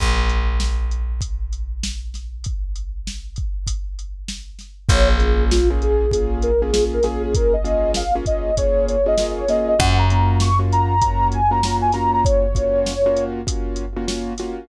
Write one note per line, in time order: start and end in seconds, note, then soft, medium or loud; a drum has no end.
0.00 4.53 A#1 medium
0.00 kick loud
0.00 closed hi-hat loud
0.29 closed hi-hat medium
0.60 snare loud
0.91 closed hi-hat medium
1.21 kick medium
1.21 closed hi-hat loud
1.53 closed hi-hat medium
1.83 snare loud
2.14 snare medium
2.14 closed hi-hat medium
2.44 kick medium
2.44 closed hi-hat medium
2.76 closed hi-hat medium
3.07 snare loud
3.36 kick medium
3.36 closed hi-hat medium
3.67 kick medium
3.67 closed hi-hat loud
3.99 closed hi-hat medium
4.28 snare loud
4.59 snare medium
4.59 closed hi-hat medium
4.89 9.42 A#1 loud
4.89 5.16 A#3 medium
4.89 5.16 C#4 medium
4.89 5.16 F4 medium
4.89 5.16 G#4 medium
4.89 5.08 C#5 loud
4.89 kick loud
4.89 closed hi-hat loud
5.09 5.44 G#4 medium
5.20 5.59 A#3 medium
5.20 5.59 C#4 medium
5.20 5.59 F4 medium
5.20 5.59 G#4 medium
5.20 closed hi-hat medium
5.51 5.69 F4 loud
5.51 snare loud
5.70 6.06 A#3 medium
5.70 6.06 C#4 medium
5.70 6.06 F4 medium
5.70 6.06 G#4 medium
5.82 6.11 G#4 loud
5.82 closed hi-hat medium
6.11 6.50 A#3 medium
6.11 6.50 C#4 medium
6.11 6.50 F4 medium
6.11 6.39 G#4 medium
6.11 6.50 G#4 medium
6.11 kick loud
6.11 closed hi-hat loud
6.42 6.61 A#4 medium
6.42 closed hi-hat medium
6.61 6.71 A#3 medium
6.61 6.71 C#4 medium
6.61 6.71 F4 medium
6.61 6.84 G#4 medium
6.61 6.71 G#4 medium
6.73 6.99 A#3 medium
6.73 6.99 C#4 medium
6.73 6.99 F4 medium
6.73 6.99 G#4 medium
6.73 snare loud
6.93 7.04 A#4 loud
7.03 7.56 A#3 medium
7.03 7.56 C#4 medium
7.03 7.56 F4 medium
7.03 7.56 G#4 loud
7.03 7.22 G#4 medium
7.03 snare medium
7.03 closed hi-hat medium
7.24 7.35 G#4 loud
7.34 7.53 A#4 loud
7.34 kick loud
7.34 closed hi-hat loud
7.53 7.92 D#5 medium
7.64 8.03 A#3 medium
7.64 8.03 C#4 medium
7.64 8.03 F4 medium
7.64 8.03 G#4 medium
7.64 closed hi-hat medium
7.94 8.14 F5 loud
7.94 snare loud
8.15 8.51 A#3 medium
8.15 8.51 C#4 medium
8.15 8.51 F4 medium
8.15 8.51 G#4 medium
8.26 8.55 D#5 medium
8.26 kick loud
8.26 closed hi-hat medium
8.57 8.96 A#3 medium
8.57 8.96 C#4 medium
8.57 8.96 F4 medium
8.57 8.96 G#4 medium
8.57 8.86 C#5 loud
8.57 kick loud
8.57 closed hi-hat loud
8.89 9.07 C#5 medium
8.89 closed hi-hat medium
9.06 9.15 A#3 medium
9.06 9.15 C#4 medium
9.06 9.15 F4 medium
9.06 9.15 G#4 medium
9.06 9.33 D#5 loud
9.18 9.45 A#3 medium
9.18 9.45 C#4 medium
9.18 9.45 F4 medium
9.18 9.45 G#4 medium
9.18 snare loud
9.38 9.49 C#5 loud
9.48 9.75 A#3 medium
9.48 9.75 C#4 medium
9.48 9.75 F4 medium
9.48 9.75 G#4 medium
9.48 9.67 D#5 medium
9.48 snare medium
9.48 closed hi-hat medium
9.68 9.79 D#5 medium
9.79 14.32 F#2 loud
9.79 10.05 A#3 loud
9.79 10.05 C#4 medium
9.79 10.05 F4 loud
9.79 10.05 F#4 loud
9.79 9.97 F#5 loud
9.79 kick loud
9.79 closed hi-hat loud
9.98 10.37 A#5 medium
10.10 10.49 A#3 medium
10.10 10.49 C#4 medium
10.10 10.49 F4 medium
10.10 10.49 F#4 medium
10.10 closed hi-hat medium
10.40 10.59 C#6 loud
10.40 snare loud
10.59 10.95 A#3 medium
10.59 10.95 C#4 medium
10.59 10.95 F4 medium
10.59 10.95 F#4 medium
10.72 11.01 A#5 loud
10.72 closed hi-hat medium
11.01 11.40 A#3 medium
11.01 11.40 C#4 medium
11.01 11.40 F4 medium
11.01 11.40 F#4 medium
11.01 11.28 A#5 loud
11.01 kick loud
11.01 closed hi-hat loud
11.32 11.51 G#5 loud
11.32 closed hi-hat medium
11.51 11.60 A#3 medium
11.51 11.60 C#4 medium
11.51 11.60 F4 medium
11.51 11.60 F#4 medium
11.51 11.76 A#5 loud
11.63 11.91 A#3 medium
11.63 11.91 C#4 medium
11.63 11.91 F4 medium
11.63 11.91 F#4 medium
11.63 snare loud
11.82 11.93 G#5 loud
11.92 12.46 A#3 medium
11.92 12.46 C#4 medium
11.92 12.46 F4 medium
11.92 12.46 F#4 medium
11.92 12.11 A#5 loud
11.92 snare medium
11.92 closed hi-hat medium
12.13 12.24 A#5 loud
12.25 13.24 C#5 loud
12.25 kick loud
12.25 closed hi-hat loud
12.55 12.93 A#3 medium
12.55 12.93 C#4 medium
12.55 12.93 F4 medium
12.55 12.93 F#4 medium
12.55 kick loud
12.55 closed hi-hat loud
12.86 snare loud
13.06 13.41 A#3 medium
13.06 13.41 C#4 medium
13.06 13.41 F4 medium
13.06 13.41 F#4 medium
13.17 closed hi-hat medium
13.47 13.85 A#3 medium
13.47 13.85 C#4 medium
13.47 13.85 F4 medium
13.47 13.85 F#4 medium
13.47 kick loud
13.47 closed hi-hat loud
13.76 closed hi-hat medium
13.96 14.06 A#3 medium
13.96 14.06 C#4 medium
13.96 14.06 F4 medium
13.96 14.06 F#4 medium
14.08 14.33 A#3 medium
14.08 14.33 C#4 medium
14.08 14.33 F4 medium
14.08 14.33 F#4 medium
14.08 snare loud
14.38 14.66 A#3 medium
14.38 14.66 C#4 medium
14.38 14.66 F4 medium
14.38 14.66 F#4 medium
14.38 snare medium
14.38 closed hi-hat medium